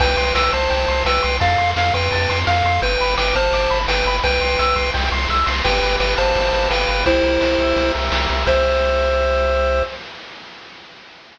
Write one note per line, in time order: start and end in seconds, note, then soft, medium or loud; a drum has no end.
0.00 0.16 C2 loud
0.00 0.34 B4 medium
0.00 0.34 G5 medium
0.00 0.16 G5 medium
0.00 kick loud
0.00 crash loud
0.17 0.32 C2 medium
0.17 0.33 C6 medium
0.17 ride medium
0.35 0.50 C2 medium
0.35 0.52 B4 medium
0.35 0.52 G5 medium
0.35 0.51 E6 medium
0.35 snare loud
0.53 0.68 C2 medium
0.53 1.03 C5 medium
0.53 1.03 A5 medium
0.53 0.69 C6 medium
0.53 kick medium
0.53 ride medium
0.70 0.86 C2 medium
0.70 0.86 G5 medium
0.70 kick medium
0.70 ride loud
0.88 1.03 C2 medium
0.88 1.04 C6 medium
0.88 ride medium
1.05 1.20 C2 medium
1.05 1.37 B4 medium
1.05 1.37 G5 medium
1.05 1.22 E6 medium
1.05 snare loud
1.22 1.39 C2 medium
1.22 1.38 C6 medium
1.22 ride medium
1.40 1.56 F2 loud
1.40 1.70 A4 medium
1.40 1.70 F5 medium
1.40 1.56 A5 medium
1.40 kick loud
1.40 ride loud
1.58 1.74 F2 medium
1.58 1.74 C6 medium
1.58 ride medium
1.76 1.91 F2 medium
1.76 1.93 A4 medium
1.76 1.93 F5 medium
1.76 1.93 F6 medium
1.76 snare loud
1.94 2.09 F2 medium
1.94 2.39 B4 medium
1.94 2.39 G5 medium
1.94 2.10 C6 medium
1.94 kick medium
1.94 ride medium
2.12 2.27 F2 medium
2.12 2.28 A5 medium
2.12 kick medium
2.12 ride loud
2.29 2.44 F2 medium
2.29 2.45 C6 medium
2.29 ride medium
2.47 2.62 F2 medium
2.47 2.80 A4 medium
2.47 2.80 F5 medium
2.47 2.63 F6 medium
2.47 snare loud
2.64 2.79 F2 medium
2.64 2.81 C6 medium
2.64 ride medium
2.82 2.97 G1 loud
2.82 3.15 B4 medium
2.82 2.98 G5 medium
2.82 3.15 G5 medium
2.82 kick loud
2.82 ride loud
3.00 3.16 G1 medium
3.00 3.16 B5 medium
3.00 ride medium
3.17 3.33 G1 medium
3.17 3.35 B4 medium
3.17 3.35 G5 medium
3.17 3.33 D6 medium
3.17 snare loud
3.35 3.50 G1 medium
3.35 3.79 C5 medium
3.35 3.79 A5 medium
3.35 3.52 F6 medium
3.35 kick medium
3.35 ride medium
3.52 3.67 G1 medium
3.52 3.69 D6 medium
3.52 kick medium
3.52 ride loud
3.70 3.86 G1 medium
3.70 3.86 B5 medium
3.70 ride medium
3.88 4.03 G1 medium
3.88 4.17 B4 medium
3.88 4.17 G5 medium
3.88 4.04 G5 medium
3.88 snare loud
4.05 4.20 G1 medium
4.05 4.23 B5 medium
4.05 ride medium
4.24 4.39 C2 medium
4.24 4.90 B4 medium
4.24 4.90 G5 medium
4.24 4.40 G5 medium
4.24 kick loud
4.24 ride loud
4.41 4.56 C2 medium
4.41 4.57 C6 medium
4.41 ride medium
4.59 4.74 C2 medium
4.59 4.75 E6 medium
4.59 snare loud
4.76 4.91 C2 medium
4.76 4.92 C6 medium
4.76 kick loud
4.76 ride medium
4.94 5.10 C2 medium
4.94 5.10 G5 medium
4.94 kick medium
4.94 ride loud
5.12 5.27 C2 medium
5.12 5.28 C6 medium
5.12 ride medium
5.29 5.44 C2 medium
5.29 5.46 E6 medium
5.29 kick medium
5.29 snare medium
5.46 5.62 C2 medium
5.46 5.62 C6 medium
5.46 snare loud
5.64 5.80 G1 loud
5.64 6.70 G4 medium
5.64 5.96 B4 medium
5.64 5.96 G5 medium
5.64 kick loud
5.64 crash loud
5.82 5.97 G1 medium
5.82 6.52 B4 medium
5.82 ride medium
6.00 6.15 G1 medium
6.00 6.14 B4 medium
6.00 6.35 D5 medium
6.00 6.14 G5 medium
6.00 snare loud
6.17 6.33 G1 medium
6.17 6.68 C5 medium
6.17 7.01 F5 medium
6.17 6.68 A5 medium
6.17 kick medium
6.17 ride medium
6.35 6.51 G1 medium
6.35 7.03 D5 medium
6.35 kick loud
6.35 ride loud
6.52 6.68 G1 medium
6.52 6.87 B4 medium
6.52 ride medium
6.70 6.85 G1 medium
6.70 7.04 G4 medium
6.70 7.04 B4 medium
6.70 7.04 G5 medium
6.70 snare loud
6.88 7.04 G1 medium
6.88 7.05 B4 medium
6.88 ride medium
7.06 7.21 C2 loud
7.06 7.92 E4 medium
7.06 8.12 G4 medium
7.06 7.92 C5 loud
7.06 kick loud
7.06 ride loud
7.23 7.38 C2 medium
7.23 7.94 A#4 medium
7.23 ride medium
7.41 7.56 C2 medium
7.41 7.76 C5 medium
7.41 snare loud
7.59 7.74 C2 medium
7.59 8.43 E5 medium
7.59 kick medium
7.59 ride medium
7.76 7.91 C2 medium
7.76 8.44 C5 medium
7.76 kick medium
7.76 ride loud
7.94 8.10 C2 medium
7.94 8.29 A#4 medium
7.94 ride medium
8.12 8.27 C2 medium
8.12 8.46 G4 medium
8.12 snare loud
8.29 8.45 C2 medium
8.29 8.47 A#4 medium
8.29 ride medium
8.46 9.83 C2 loud
8.46 9.82 G4 loud
8.46 9.82 C5 medium
8.46 9.83 C5 loud
8.46 9.82 E5 loud
8.46 kick loud
8.46 crash loud